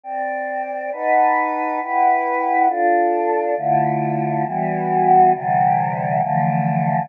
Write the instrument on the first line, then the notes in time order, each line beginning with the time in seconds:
choir aahs
0.04 C4 D5 G5
0.92 D#4 B4 F#5 A5
1.80 E4 B4 F#5 G5
2.68 D4 F4 A4
3.57 D3 A3 E4 F4
4.45 E3 G3 B3 F#4
5.34 C3 D3 E3 G3
6.21 D3 E3 F3 A3